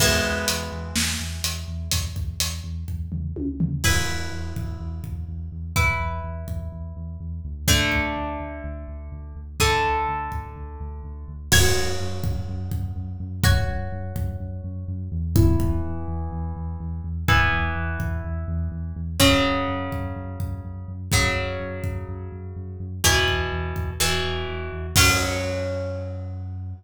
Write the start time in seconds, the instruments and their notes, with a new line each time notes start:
0.00 synth bass 1 E2, acoustic guitar (steel) E3 G#3 B3, kick, crash
0.24 synth bass 1 E2
0.48 synth bass 1 E2, closed hi-hat
0.72 synth bass 1 E2
0.96 synth bass 1 E2, snare
1.20 synth bass 1 E2
1.44 synth bass 1 E2, closed hi-hat
1.68 synth bass 1 E2
1.91 synth bass 1 E2, kick, closed hi-hat
2.16 synth bass 1 E2, kick
2.40 synth bass 1 E2, closed hi-hat
2.64 synth bass 1 E2
2.88 synth bass 1 E2, kick
3.12 synth bass 1 E2, floor tom
3.36 synth bass 1 D2, high tom
3.60 synth bass 1 D#2, floor tom
3.84 synth bass 1 E2, acoustic guitar (steel) E4 B4, kick, crash
4.08 synth bass 1 E2
4.32 synth bass 1 E2
4.56 synth bass 1 E2, kick
4.80 synth bass 1 E2
5.04 synth bass 1 E2, kick
5.28 synth bass 1 E2
5.52 synth bass 1 E2
5.76 synth bass 1 E2, acoustic guitar (steel) E4 B4, kick
6.00 synth bass 1 E2
6.24 synth bass 1 E2
6.48 synth bass 1 E2, kick
6.72 synth bass 1 E2
6.96 synth bass 1 E2
7.20 synth bass 1 E2
7.44 synth bass 1 D2
7.68 acoustic guitar (steel) D3 A3, kick
7.92 synth bass 1 D2, kick
8.16 synth bass 1 D2
8.40 synth bass 1 D2
8.64 synth bass 1 D2
8.88 synth bass 1 D2
9.12 synth bass 1 D2
9.36 synth bass 1 D2
9.60 synth bass 1 D2, acoustic guitar (steel) D3 A3, kick
9.84 synth bass 1 D2
10.08 synth bass 1 D2
10.32 synth bass 1 D2, kick
10.56 synth bass 1 D2
10.80 synth bass 1 D2
11.04 synth bass 1 D2
11.28 synth bass 1 D2
11.52 synth bass 1 F#2, acoustic guitar (steel) F#4 C#5, kick, crash
11.76 synth bass 1 F#2
12.00 synth bass 1 F#2
12.24 synth bass 1 F#2, kick
12.48 synth bass 1 F#2
12.71 synth bass 1 F#2, kick
12.96 synth bass 1 F#2
13.20 synth bass 1 F#2
13.44 synth bass 1 F#2, acoustic guitar (steel) F#4 C#5, kick
13.68 synth bass 1 F#2
13.92 synth bass 1 F#2
14.16 synth bass 1 F#2, kick
14.40 synth bass 1 F#2
14.64 synth bass 1 F#2
14.88 synth bass 1 F#2
15.12 synth bass 1 E2
15.36 acoustic guitar (steel) E3 B3, kick
15.60 synth bass 1 E2, kick
15.84 synth bass 1 E2
16.08 synth bass 1 E2
16.32 synth bass 1 E2
16.56 synth bass 1 E2
16.80 synth bass 1 E2
17.04 synth bass 1 E2
17.28 synth bass 1 E2, acoustic guitar (steel) E3 B3, kick
17.52 synth bass 1 E2
17.76 synth bass 1 E2
18.00 synth bass 1 E2, kick
18.24 synth bass 1 E2
18.48 synth bass 1 E2
18.72 synth bass 1 E2
18.96 synth bass 1 E2
19.20 synth bass 1 F#2, acoustic guitar (steel) C#3 F#3, kick
19.44 synth bass 1 F#2
19.68 synth bass 1 F#2
19.92 synth bass 1 F#2, kick
20.16 synth bass 1 F#2
20.40 synth bass 1 F#2, kick
20.64 synth bass 1 F#2
20.88 synth bass 1 F#2
21.12 synth bass 1 F#2, acoustic guitar (steel) C#3 F#3, kick
21.36 synth bass 1 F#2
21.60 synth bass 1 F#2
21.84 synth bass 1 F#2, kick
22.08 synth bass 1 F#2
22.32 synth bass 1 F#2
22.56 synth bass 1 F#2
22.80 synth bass 1 F#2
23.04 synth bass 1 E2, acoustic guitar (steel) B2 E3, kick
23.28 synth bass 1 E2, kick
23.52 synth bass 1 E2
23.76 synth bass 1 E2, kick
24.00 synth bass 1 E2, acoustic guitar (steel) B2 E3
24.24 synth bass 1 E2
24.48 synth bass 1 E2
24.72 synth bass 1 E2
24.96 synth bass 1 F#2, acoustic guitar (steel) F#3 C#4, kick, crash